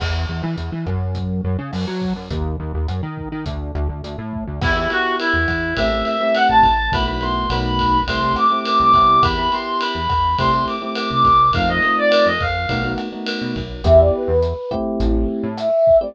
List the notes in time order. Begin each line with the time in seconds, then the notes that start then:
0.00 E2, kick, cross-stick, crash
0.29 E2
0.43 E3
0.58 E2, closed hi-hat
0.72 E3
0.86 F#2, kick, cross-stick
1.15 kick, closed hi-hat
1.44 F#2
1.59 C#3
1.73 F#2, cross-stick, open hi-hat
1.87 F#3
2.02 kick
2.16 F#2
2.31 D#2, kick, closed hi-hat
2.60 D#2
2.74 D#2
2.88 F#2, cross-stick, closed hi-hat
3.03 D#3
3.17 kick
3.32 D#3
3.46 D2, kick, closed hi-hat
3.75 D2, cross-stick
3.89 D2
4.04 D2, closed hi-hat
4.18 A2
4.33 kick
4.47 D2
4.61 E2 B3 E4 G4, kick, cross-stick, crash
4.76 B3 E4 G4
4.90 B3 E4 F#4 G4, ride
5.19 E4, ride
5.33 E2
5.48 E2, kick, cross-stick, ride
5.77 A1 A3 C4 E4 G4 E5, kick, ride
5.92 A3 C4 E4 G4
6.05 E5, ride
6.20 A3 C4 E4 G4 E5
6.35 F#5, cross-stick, ride
6.49 A1 A5
6.63 A1, kick, ride
6.92 B1 A3 B3 E4 F#4 B5, kick, ride
7.06 A3 B3 E4 F#4 B5
7.21 A3 B3 E4 F#4 C6, ride
7.50 B1 A3 B3 D#4 F#4 B5, cross-stick, ride
7.79 kick, ride
8.07 C2 A3 C4 E4 G4 C6, kick, ride
8.22 A3 C4 E4 G4
8.36 D6, cross-stick, ride
8.50 A3 C4 E4 G4 D6
8.65 D6, ride
8.80 C2 D6
8.94 C2 B3 E4 G4, kick, ride
9.23 E2 B5, kick, cross-stick, ride
9.38 B3 E4 G4 B5
9.51 B3 E4 G4 C6, ride
9.81 B5, ride
9.95 E2
10.09 E2, kick, cross-stick, ride
10.38 C2 A3 C4 E4 G4 C6, kick, ride
10.53 A3 C4 E4 G4
10.67 D6, ride
10.82 A3 C4 E4 G4 D6
10.95 D6, cross-stick, ride
11.10 C2 D6
11.25 C2, kick, ride
11.53 F2 A3 C4 D#4 F4 F5, kick, ride
11.69 A3 C4 D#4 F4 D#5
11.82 A3 C4 D#4 F4, ride
11.98 D5
12.11 cross-stick, ride
12.26 F2 D#5
12.40 F2 F5, kick, ride
12.69 B1 A3 B3 D#4 F#4, kick, ride
12.84 A3 B3 D#4 F#4
12.98 cross-stick, ride
13.12 A3 B3 D#4 F#4
13.26 ride
13.41 B2
13.56 B1, kick, ride
13.84 E2 B3 E4 G4 E5, kick, cross-stick, closed hi-hat
13.99 D5
14.13 B4
14.28 E2
14.43 closed hi-hat
14.71 A3 C4 E4 G4, kick, cross-stick
15.00 A1 E4, kick, closed hi-hat
15.43 A2
15.57 E5, cross-stick, closed hi-hat
15.87 kick
16.00 A3 C4 E4 G4 D5